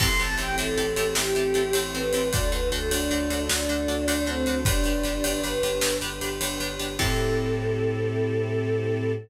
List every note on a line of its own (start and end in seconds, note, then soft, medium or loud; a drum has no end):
0.00 0.16 A1 loud
0.00 0.08 C4 medium
0.00 2.30 C4 medium
0.00 0.08 E4 medium
0.00 2.30 E4 medium
0.00 0.08 G4 loud
0.00 2.30 G4 medium
0.00 0.08 A4 medium
0.00 2.30 A4 medium
0.00 0.19 C6 loud
0.00 kick loud
0.00 crash loud
0.19 0.36 A1 loud
0.19 0.27 C4 medium
0.19 0.27 E4 medium
0.19 0.27 G4 medium
0.19 0.27 A4 medium
0.19 0.35 A5 medium
0.19 ride medium
0.38 0.55 A1 loud
0.38 0.46 C4 medium
0.38 0.46 E4 medium
0.38 0.46 G4 medium
0.38 0.46 A4 medium
0.38 0.55 G5 loud
0.38 ride medium
0.58 0.74 A1 medium
0.58 0.66 C4 medium
0.58 0.66 E4 medium
0.58 0.66 G4 medium
0.58 0.66 A4 medium
0.58 1.11 A4 loud
0.58 ride loud
0.78 0.94 A1 medium
0.78 0.85 C4 medium
0.78 0.85 E4 medium
0.78 0.85 G4 medium
0.78 0.85 A4 medium
0.78 ride medium
0.96 1.13 A1 medium
0.96 1.05 C4 medium
0.96 1.05 E4 medium
0.96 1.05 G4 medium
0.96 1.05 A4 medium
0.96 ride loud
1.15 1.33 A1 loud
1.15 1.24 C4 medium
1.15 1.24 E4 medium
1.15 1.24 G4 medium
1.15 1.80 G4 loud
1.15 1.24 A4 medium
1.15 snare loud
1.35 1.53 A1 loud
1.35 1.44 C4 medium
1.35 1.44 E4 medium
1.35 1.44 G4 medium
1.35 1.44 A4 medium
1.35 ride medium
1.54 1.72 A1 medium
1.54 1.63 C4 medium
1.54 1.63 E4 medium
1.54 1.63 G4 medium
1.54 1.63 A4 medium
1.54 ride loud
1.73 1.91 A1 medium
1.73 1.83 C4 medium
1.73 1.83 E4 medium
1.73 1.83 G4 medium
1.73 1.83 A4 medium
1.73 ride loud
1.94 2.11 A1 medium
1.94 2.02 C4 medium
1.94 2.02 E4 medium
1.94 2.02 G4 medium
1.94 2.02 A4 medium
1.94 2.29 B4 medium
1.94 ride medium
2.13 2.30 A1 medium
2.13 2.22 C4 medium
2.13 2.22 E4 medium
2.13 2.22 G4 medium
2.13 2.22 A4 medium
2.13 ride loud
2.32 2.50 D2 loud
2.32 4.63 D4 medium
2.32 2.41 D4 medium
2.32 4.63 F#4 medium
2.32 2.41 F#4 medium
2.32 4.63 A4 medium
2.32 2.41 A4 loud
2.32 2.50 D5 loud
2.32 kick loud
2.32 ride loud
2.52 2.69 D2 medium
2.52 2.60 D4 medium
2.52 2.60 F#4 medium
2.52 2.60 A4 medium
2.52 2.69 B4 loud
2.52 ride medium
2.72 2.88 D2 loud
2.72 2.80 D4 medium
2.72 2.80 F#4 medium
2.72 2.89 A4 medium
2.72 2.80 A4 medium
2.72 ride loud
2.91 3.08 D2 medium
2.91 2.99 D4 medium
2.91 3.44 D4 medium
2.91 2.99 F#4 medium
2.91 2.99 A4 medium
2.91 ride loud
3.10 3.27 D2 loud
3.10 3.19 D4 medium
3.10 3.19 F#4 medium
3.10 3.19 A4 medium
3.10 ride medium
3.30 3.47 D2 medium
3.30 3.38 D4 medium
3.30 3.38 F#4 medium
3.30 3.38 A4 medium
3.30 ride loud
3.49 3.66 D2 medium
3.49 3.57 D4 medium
3.49 4.26 D4 loud
3.49 3.57 F#4 medium
3.49 3.57 A4 medium
3.49 snare loud
3.69 3.85 D2 medium
3.69 3.77 D4 medium
3.69 3.77 F#4 medium
3.69 3.77 A4 medium
3.69 ride medium
3.88 4.05 D2 medium
3.88 3.96 D4 medium
3.88 3.96 F#4 medium
3.88 3.96 A4 medium
3.88 ride medium
4.08 4.24 D2 medium
4.08 4.15 D4 medium
4.08 4.15 F#4 medium
4.08 4.15 A4 medium
4.08 ride loud
4.26 4.44 D2 loud
4.26 4.59 C4 loud
4.26 4.35 D4 medium
4.26 4.35 F#4 medium
4.26 4.35 A4 medium
4.26 ride medium
4.46 4.63 D2 medium
4.46 4.55 D4 medium
4.46 4.55 F#4 medium
4.46 4.55 A4 medium
4.46 ride medium
4.65 4.82 G1 loud
4.65 5.39 D4 loud
4.65 6.96 D4 medium
4.65 4.74 D4 medium
4.65 6.96 G4 medium
4.65 4.74 G4 medium
4.65 6.96 B4 medium
4.65 4.74 B4 medium
4.65 kick loud
4.65 ride loud
4.84 5.02 G1 medium
4.84 4.93 D4 medium
4.84 4.93 G4 medium
4.84 4.93 B4 medium
4.84 ride loud
5.03 5.21 G1 medium
5.03 5.13 D4 medium
5.03 5.13 G4 medium
5.03 5.13 B4 medium
5.03 ride loud
5.24 5.41 G1 medium
5.24 5.32 D4 medium
5.24 5.32 G4 medium
5.24 5.32 B4 medium
5.24 ride loud
5.43 5.60 G1 medium
5.43 5.52 D4 medium
5.43 5.52 G4 medium
5.43 5.52 B4 medium
5.43 5.96 B4 medium
5.43 ride medium
5.63 5.80 G1 medium
5.63 5.71 D4 medium
5.63 5.71 G4 medium
5.63 5.71 B4 medium
5.63 ride loud
5.81 5.99 G1 loud
5.81 5.90 D4 medium
5.81 5.90 G4 medium
5.81 5.90 B4 medium
5.81 snare loud
6.01 6.19 G1 medium
6.01 6.10 D4 medium
6.01 6.10 G4 medium
6.01 6.10 B4 medium
6.01 ride medium
6.21 6.38 G1 medium
6.21 6.29 D4 medium
6.21 6.29 G4 medium
6.21 6.29 B4 medium
6.21 ride loud
6.41 6.57 G1 medium
6.41 6.49 D4 medium
6.41 6.49 G4 medium
6.41 6.49 B4 medium
6.41 ride loud
6.60 6.76 G1 medium
6.60 6.68 D4 medium
6.60 6.68 G4 medium
6.60 6.68 B4 medium
6.60 ride medium
6.79 6.96 G1 medium
6.79 6.87 D4 medium
6.79 6.87 G4 medium
6.79 6.87 B4 medium
6.79 ride medium
6.99 9.12 A2 loud
6.99 9.12 C4 loud
6.99 9.13 C4 loud
6.99 9.12 E4 loud
6.99 9.13 E4 loud
6.99 9.12 G4 loud
6.99 9.13 G4 loud
6.99 9.12 A4 loud
6.99 9.13 A4 loud
6.99 kick loud
6.99 crash loud